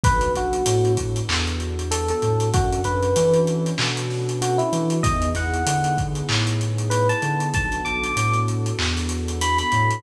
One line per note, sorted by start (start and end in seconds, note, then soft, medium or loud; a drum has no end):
0.04 0.31 B1 medium
0.04 2.49 B3 medium
0.04 2.49 D4 medium
0.04 2.49 F#4 medium
0.04 2.49 A4 medium
0.04 0.32 B4 loud
0.04 kick loud
0.04 closed hi-hat loud
0.21 closed hi-hat medium
0.35 0.62 B1 medium
0.35 0.92 F#4 loud
0.35 closed hi-hat medium
0.53 closed hi-hat medium
0.66 1.21 A2 medium
0.66 closed hi-hat loud
0.85 closed hi-hat medium
0.97 kick medium
0.97 closed hi-hat medium
1.16 closed hi-hat medium
1.29 2.11 E2 medium
1.29 clap loud
1.47 closed hi-hat medium
1.60 closed hi-hat medium
1.79 closed hi-hat medium
1.91 2.08 A4 loud
1.91 closed hi-hat loud
2.08 2.49 A4 medium
2.08 closed hi-hat medium
2.22 2.50 A2 medium
2.22 closed hi-hat medium
2.40 closed hi-hat medium
2.54 2.81 F#2 medium
2.54 5.01 C#4 medium
2.54 5.01 D4 medium
2.54 2.81 F#4 loud
2.54 5.01 F#4 medium
2.54 5.01 A4 medium
2.54 kick loud
2.54 closed hi-hat loud
2.73 closed hi-hat medium
2.84 3.12 F#2 medium
2.84 3.39 B4 loud
2.84 closed hi-hat medium
3.03 closed hi-hat medium
3.16 3.71 E3 medium
3.16 closed hi-hat loud
3.34 closed hi-hat medium
3.47 closed hi-hat medium
3.66 closed hi-hat medium
3.78 4.61 B2 medium
3.78 clap loud
3.97 closed hi-hat medium
4.10 snare soft
4.29 closed hi-hat medium
4.42 4.59 F#4 loud
4.42 closed hi-hat loud
4.58 4.97 E4 medium
4.58 closed hi-hat medium
4.73 5.00 E3 medium
4.73 closed hi-hat medium
4.90 closed hi-hat medium
5.03 5.31 E2 medium
5.03 7.50 B3 medium
5.03 7.50 D#4 medium
5.03 7.50 E4 medium
5.03 7.50 G#4 medium
5.03 5.29 D#5 loud
5.03 kick loud
5.03 closed hi-hat loud
5.22 closed hi-hat medium
5.35 5.62 E2 medium
5.35 5.97 F#5 medium
5.35 snare soft
5.35 closed hi-hat medium
5.54 closed hi-hat medium
5.66 6.21 D3 medium
5.66 closed hi-hat loud
5.84 closed hi-hat medium
5.98 kick medium
5.98 closed hi-hat medium
6.15 closed hi-hat medium
6.29 7.11 A2 medium
6.29 clap loud
6.47 closed hi-hat medium
6.61 closed hi-hat medium
6.78 closed hi-hat medium
6.90 7.07 B4 medium
6.90 closed hi-hat loud
7.09 7.48 A5 loud
7.09 closed hi-hat medium
7.22 7.50 D3 medium
7.22 closed hi-hat medium
7.40 closed hi-hat medium
7.54 7.81 B1 medium
7.54 10.01 B3 medium
7.54 10.01 D4 medium
7.54 10.01 F#4 medium
7.54 10.01 A4 medium
7.54 7.82 A5 loud
7.54 kick loud
7.54 closed hi-hat medium
7.72 closed hi-hat medium
7.85 8.12 B1 medium
7.85 8.39 D6 loud
7.85 closed hi-hat medium
8.04 closed hi-hat medium
8.16 8.71 A2 medium
8.16 closed hi-hat loud
8.33 closed hi-hat medium
8.48 closed hi-hat medium
8.66 closed hi-hat medium
8.79 9.61 E2 medium
8.79 clap loud
8.97 snare soft
8.97 closed hi-hat medium
9.09 closed hi-hat medium
9.28 closed hi-hat medium
9.41 9.58 B5 loud
9.41 closed hi-hat loud
9.58 9.99 B5 loud
9.58 closed hi-hat medium
9.72 10.00 A2 medium
9.72 closed hi-hat medium
9.91 closed hi-hat medium